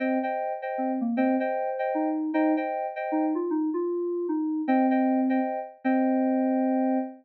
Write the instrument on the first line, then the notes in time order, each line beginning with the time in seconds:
electric piano 2
0.00 C4 C5 D#5 G5
0.23 C5 D#5 G5
0.62 C5 D#5 G5
0.78 C4
1.01 A#3
1.17 C4 C5 D#5 G5
1.40 C5 D#5 G5
1.79 C5 D#5 G5
1.95 D#4
2.34 D#4 C5 D#5 G5
2.57 C5 D#5 G5
2.96 C5 D#5 G5
3.12 D#4
3.35 F4
3.50 D#4
3.74 F4
4.29 D#4
4.68 C4 C5 D#5 G5
4.91 C5 D#5 G5
5.30 C5 D#5 G5
5.84 C4 C5 D#5 G5